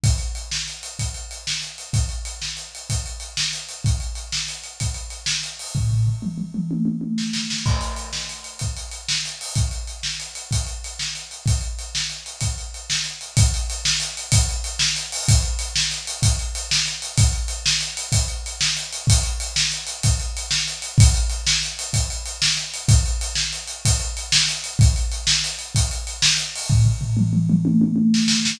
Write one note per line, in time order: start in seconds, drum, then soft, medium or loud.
0.04 kick loud
0.04 closed hi-hat loud
0.18 closed hi-hat medium
0.35 closed hi-hat medium
0.51 snare loud
0.68 closed hi-hat medium
0.83 closed hi-hat medium
0.99 kick medium
0.99 closed hi-hat medium
1.14 closed hi-hat medium
1.31 closed hi-hat medium
1.47 snare loud
1.62 closed hi-hat medium
1.78 closed hi-hat medium
1.93 kick loud
1.93 closed hi-hat loud
2.09 closed hi-hat medium
2.25 closed hi-hat medium
2.42 snare medium
2.57 closed hi-hat medium
2.75 closed hi-hat medium
2.90 kick medium
2.90 closed hi-hat loud
3.06 closed hi-hat medium
3.20 closed hi-hat medium
3.37 snare loud
3.53 closed hi-hat medium
3.69 closed hi-hat medium
3.84 kick loud
3.84 closed hi-hat medium
4.00 closed hi-hat medium
4.15 closed hi-hat medium
4.32 snare loud
4.48 closed hi-hat medium
4.64 closed hi-hat medium
4.80 kick medium
4.80 closed hi-hat medium
4.94 closed hi-hat medium
5.10 closed hi-hat medium
5.26 snare loud
5.43 closed hi-hat medium
5.59 open hi-hat medium
5.75 kick medium
5.75 floor tom medium
5.91 floor tom medium
6.07 floor tom medium
6.22 mid tom medium
6.38 mid tom medium
6.54 mid tom medium
6.71 high tom medium
6.85 high tom medium
7.01 high tom medium
7.18 snare medium
7.33 snare medium
7.50 snare medium
7.66 kick loud
7.66 crash loud
7.81 closed hi-hat medium
7.96 closed hi-hat medium
8.13 snare medium
8.29 closed hi-hat medium
8.44 closed hi-hat medium
8.59 kick medium
8.59 closed hi-hat medium
8.77 closed hi-hat medium
8.91 closed hi-hat medium
9.08 snare loud
9.25 closed hi-hat medium
9.41 open hi-hat medium
9.55 kick loud
9.55 closed hi-hat medium
9.71 closed hi-hat medium
9.87 closed hi-hat medium
10.03 snare loud
10.20 closed hi-hat medium
10.35 closed hi-hat medium
10.51 kick medium
10.51 closed hi-hat loud
10.67 closed hi-hat medium
10.84 closed hi-hat medium
10.99 snare loud
11.15 closed hi-hat medium
11.31 closed hi-hat medium
11.46 kick loud
11.46 closed hi-hat loud
11.61 closed hi-hat medium
11.79 closed hi-hat medium
11.95 snare loud
12.10 closed hi-hat medium
12.26 closed hi-hat medium
12.41 kick medium
12.41 closed hi-hat loud
12.58 closed hi-hat medium
12.74 closed hi-hat medium
12.90 snare loud
13.04 closed hi-hat medium
13.21 closed hi-hat medium
13.37 kick loud
13.37 closed hi-hat loud
13.54 closed hi-hat medium
13.70 closed hi-hat medium
13.85 snare loud
14.00 closed hi-hat medium
14.17 closed hi-hat medium
14.32 kick loud
14.32 closed hi-hat loud
14.49 closed hi-hat medium
14.64 closed hi-hat medium
14.79 snare loud
14.96 closed hi-hat medium
15.12 open hi-hat medium
15.28 kick loud
15.28 closed hi-hat loud
15.43 closed hi-hat medium
15.59 closed hi-hat loud
15.76 snare loud
15.91 closed hi-hat medium
16.07 closed hi-hat loud
16.22 kick loud
16.22 closed hi-hat loud
16.39 closed hi-hat medium
16.55 closed hi-hat loud
16.71 snare loud
16.86 closed hi-hat medium
17.02 closed hi-hat medium
17.18 kick loud
17.18 closed hi-hat loud
17.33 closed hi-hat medium
17.48 closed hi-hat medium
17.66 snare loud
17.81 closed hi-hat medium
17.97 closed hi-hat loud
18.12 kick loud
18.12 closed hi-hat loud
18.28 closed hi-hat medium
18.46 closed hi-hat medium
18.61 snare loud
18.77 closed hi-hat medium
18.93 closed hi-hat medium
19.07 kick loud
19.07 closed hi-hat loud
19.23 closed hi-hat medium
19.40 closed hi-hat loud
19.56 snare loud
19.72 closed hi-hat medium
19.87 closed hi-hat medium
20.03 kick loud
20.03 closed hi-hat loud
20.20 closed hi-hat medium
20.37 closed hi-hat medium
20.51 snare loud
20.68 closed hi-hat medium
20.82 closed hi-hat medium
20.98 kick loud
20.98 closed hi-hat loud
21.14 closed hi-hat medium
21.30 closed hi-hat medium
21.47 snare loud
21.63 closed hi-hat medium
21.79 closed hi-hat loud
21.93 kick medium
21.93 closed hi-hat loud
22.10 closed hi-hat medium
22.26 closed hi-hat medium
22.42 snare loud
22.57 closed hi-hat medium
22.74 closed hi-hat medium
22.88 kick loud
22.88 closed hi-hat loud
23.06 closed hi-hat medium
23.21 closed hi-hat loud
23.35 snare loud
23.53 closed hi-hat medium
23.68 closed hi-hat medium
23.85 kick loud
23.85 closed hi-hat loud
24.00 closed hi-hat medium
24.17 closed hi-hat medium
24.32 snare loud
24.48 closed hi-hat medium
24.64 closed hi-hat medium
24.79 kick loud
24.79 closed hi-hat loud
24.96 closed hi-hat medium
25.12 closed hi-hat medium
25.27 snare loud
25.44 closed hi-hat medium
25.59 closed hi-hat medium
25.75 kick loud
25.75 closed hi-hat loud
25.91 closed hi-hat medium
26.07 closed hi-hat medium
26.22 snare loud
26.37 closed hi-hat medium
26.55 open hi-hat medium
26.70 kick loud
26.70 floor tom loud
26.85 floor tom medium
27.01 floor tom medium
27.17 mid tom loud
27.33 mid tom loud
27.50 mid tom loud
27.65 high tom loud
27.81 high tom loud
27.96 high tom medium
28.14 snare loud
28.28 snare loud
28.45 snare loud